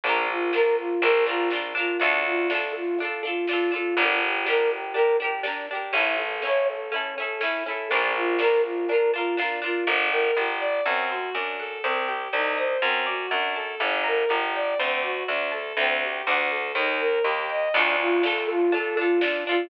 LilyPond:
<<
  \new Staff \with { instrumentName = "Flute" } { \time 4/4 \key d \minor \tempo 4 = 122 d'8 f'8 bes'8 f'8 bes'8 f'8 d'8 f'8 | d'8 f'8 a'8 f'8 a'8 f'8 f'8 f'8 | d'8 g'8 bes'8 g'8 bes'8 g'8 d'8 g'8 | e'8 a'8 cis''8 a'8 cis'8 a'8 e'8 a'8 |
d'8 f'8 bes'8 f'8 bes'8 f'8 d'8 f'8 | \key g \minor r1 | r1 | r1 |
r1 | \key d \minor d'8 f'8 a'8 f'8 a'8 f'8 d'8 f'8 | }
  \new Staff \with { instrumentName = "Violin" } { \time 4/4 \key d \minor r1 | r1 | r1 | r1 |
r1 | \key g \minor d'8 bes'8 g'8 d''8 c'8 fis'8 d'8 a'8 | c'8 g'8 ees'8 c''8 c'8 fis'8 d'8 a'8 | d'8 bes'8 g'8 d''8 c'8 fis'8 d'8 a'8 |
c'8 g'8 d'8 a'8 ees'8 bes'8 g'8 ees''8 | \key d \minor r1 | }
  \new Staff \with { instrumentName = "Pizzicato Strings" } { \time 4/4 \key d \minor <d' f' bes'>4 <d' f' bes'>4 <d' f' bes'>8 <d' f' bes'>8 <d' f' bes'>8 <d' f' bes'>8 | <d' f' a'>4 <d' f' a'>4 <d' f' a'>8 <d' f' a'>8 <d' f' a'>8 <d' f' a'>8 | <d' g' bes'>4 <d' g' bes'>4 <d' g' bes'>8 <d' g' bes'>8 <d' g' bes'>8 <d' g' bes'>8 | <cis' e' a'>4 <cis' e' a'>4 <cis' e' a'>8 <cis' e' a'>8 <cis' e' a'>8 <cis' e' a'>8 |
<d' f' bes'>4 <d' f' bes'>4 <d' f' bes'>8 <d' f' bes'>8 <d' f' bes'>8 <d' f' bes'>8 | \key g \minor bes'8 g''8 bes'8 d''8 a'8 c''8 d''8 fis''8 | c''8 g''8 c''8 ees''8 c''8 d''8 fis''8 a''8 | d''8 bes''8 d''8 g''8 c''8 d''8 fis''8 a''8 |
<c'' d'' g'' a''>4 <c'' d'' fis'' a''>4 ees''8 bes''8 ees''8 g''8 | \key d \minor <d' f' a'>4 <d' f' a'>4 <d' f' a'>8 <d' f' a'>8 <d' f' a'>8 <d' f' a'>8 | }
  \new Staff \with { instrumentName = "Electric Bass (finger)" } { \clef bass \time 4/4 \key d \minor bes,,2 bes,,2 | d,1 | g,,1 | a,,1 |
bes,,1 | \key g \minor g,,4 g,,4 fis,4 fis,4 | c,4 c,4 fis,4 fis,4 | g,,4 g,,4 d,4 d,4 |
d,4 d,4 ees,4 ees,4 | \key d \minor d,1 | }
  \new DrumStaff \with { instrumentName = "Drums" } \drummode { \time 4/4 <hh bd>4 sn4 hh4 sn4 | <hh bd>4 sn4 hh4 sn4 | <hh bd>4 sn4 hh4 sn4 | <hh bd>4 sn4 hh4 sn4 |
<hh bd>4 sn4 hh4 sn4 | r4 r4 r4 r4 | r4 r4 r4 r4 | r4 r4 r4 r4 |
r4 r4 r4 r4 | <cymc bd>4 sn4 hh4 sn4 | }
>>